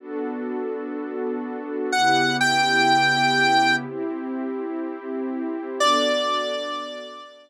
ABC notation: X:1
M:4/4
L:1/8
Q:1/4=124
K:Bm
V:1 name="Lead 1 (square)"
z8 | f2 g6 | z8 | d8 |]
V:2 name="Pad 2 (warm)"
[B,DFA]8 | [C,B,EG]8 | [=CEG]8 | [B,DFA]8 |]